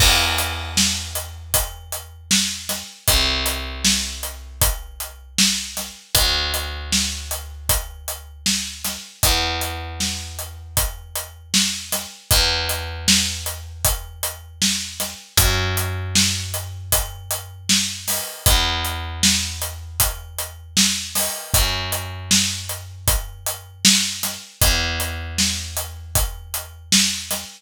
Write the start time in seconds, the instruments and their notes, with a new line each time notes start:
0.00 electric bass (finger) E2, kick, crash
0.38 closed hi-hat
0.77 snare
1.15 closed hi-hat
1.54 kick, closed hi-hat
1.92 closed hi-hat
2.31 snare
2.69 snare, closed hi-hat
3.08 electric bass (finger) C2, kick, closed hi-hat
3.46 closed hi-hat
3.85 snare
4.23 closed hi-hat
4.62 kick, closed hi-hat
5.00 closed hi-hat
5.38 snare
5.77 snare, closed hi-hat
6.15 electric bass (finger) D2, kick, closed hi-hat
6.54 closed hi-hat
6.92 snare
7.31 closed hi-hat
7.69 kick, closed hi-hat
8.08 closed hi-hat
8.46 snare
8.84 snare, closed hi-hat
9.23 electric bass (finger) E2, kick, closed hi-hat
9.61 closed hi-hat
10.00 snare
10.39 closed hi-hat
10.77 kick, closed hi-hat
11.16 closed hi-hat
11.54 snare
11.92 snare, closed hi-hat
12.31 electric bass (finger) E2, kick, closed hi-hat
12.69 closed hi-hat
13.08 snare
13.46 closed hi-hat
13.85 kick, closed hi-hat
14.23 closed hi-hat
14.62 snare
15.00 snare, closed hi-hat
15.37 electric bass (finger) F#2, kick, closed hi-hat
15.77 closed hi-hat
16.15 snare
16.54 closed hi-hat
16.92 kick, closed hi-hat
17.31 closed hi-hat
17.69 snare
18.08 snare, open hi-hat
18.46 electric bass (finger) E2, kick, closed hi-hat
18.85 closed hi-hat
19.23 snare
19.62 closed hi-hat
20.00 kick, closed hi-hat
20.38 closed hi-hat
20.77 snare
21.15 snare, open hi-hat
21.54 electric bass (finger) F#2, kick, closed hi-hat
21.92 closed hi-hat
22.31 snare
22.69 closed hi-hat
23.08 kick, closed hi-hat
23.46 closed hi-hat
23.85 snare
24.23 snare, closed hi-hat
24.62 electric bass (finger) E2, kick, closed hi-hat
25.00 closed hi-hat
25.38 snare
25.77 closed hi-hat
26.15 kick, closed hi-hat
26.54 closed hi-hat
26.92 snare
27.31 snare, closed hi-hat